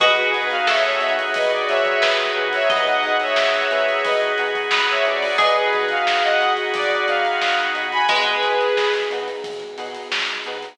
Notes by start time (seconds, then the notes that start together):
0.00 B1 B3 D#4 F#4 G#4 B4 D#5, kick, closed hi-hat
0.16 G#4 B4, closed hi-hat
0.34 B2 D#4 F#4 G#4 B4, closed hi-hat
0.50 F5, closed hi-hat
0.67 B1 A4 C#5 E5, snare
0.84 C#5 E5, snare, closed hi-hat
1.01 B2 D#4 F#4 G#4 B4, closed hi-hat
1.19 closed hi-hat
1.34 B1 B4 D#5, kick, closed hi-hat
1.50 D5, closed hi-hat
1.67 B2 D#4 F#4 G#4 B4 C#5 E5, snare, closed hi-hat
1.85 kick, closed hi-hat
2.02 B1 B4, snare
2.20 closed hi-hat
2.35 B1 D#4 F#4 G#4 B4
2.53 C#5 E5, snare, closed hi-hat
2.70 B3 D#4 F#4 G#4 B4 D#5, kick, closed hi-hat
2.86 D#5 F#5, snare, closed hi-hat
3.03 B2 D#4 F#4 G#4 B4, closed hi-hat
3.20 C#5 E5, snare, closed hi-hat
3.36 B1, snare
3.54 snare, closed hi-hat
3.70 B2 D#4 F#4 G#4 B4, closed hi-hat
3.88 closed hi-hat
4.04 B1 B4 D#5, kick, closed hi-hat
4.21 closed hi-hat
4.38 B2 D#4 F#4 G#4 B4, closed hi-hat
4.55 kick, closed hi-hat
4.71 B1 B4, snare
4.89 C#5 E5, closed hi-hat
5.05 B2 D#4 F#4 G#4 B4 D5, closed hi-hat
5.22 open hi-hat
5.38 B1 B3 D#4 F#4 G#4 B4 D#5, kick, closed hi-hat
5.56 G#4 B4, closed hi-hat
5.73 B2 D#4 F#4 G#4 B4, kick, closed hi-hat
5.89 F5, closed hi-hat
6.05 B1 F5, snare
6.23 D#5 F#5, snare, closed hi-hat
6.40 B2 D#4 F#4 G#4 B4, closed hi-hat
6.57 closed hi-hat
6.73 B1 D5, kick, closed hi-hat
6.91 D5, closed hi-hat
7.08 B2 D#4 F#4 G#4 B4 F5, closed hi-hat
7.25 closed hi-hat
7.41 B1, snare
7.58 closed hi-hat
7.74 B2 D#4 F#4 G#4 B4, closed hi-hat
7.92 G#5 B5, closed hi-hat
8.08 B1 G#3 B3 D#4 F#4 G#4 B4, kick, closed hi-hat
8.27 closed hi-hat
8.43 B2 D#4 F#4 G#4 B4, closed hi-hat
8.60 snare, closed hi-hat
8.76 B1, snare
8.93 snare, closed hi-hat
9.10 B2 D#4 F#4 G#4 B4, closed hi-hat
9.28 closed hi-hat
9.44 B1, kick, closed hi-hat
9.60 closed hi-hat
9.78 B2 D#4 F#4 G#4 B4, closed hi-hat
9.95 closed hi-hat
10.11 B1, snare
10.27 closed hi-hat
10.44 B2 D#4 F#4 G#4 B4, closed hi-hat
10.62 closed hi-hat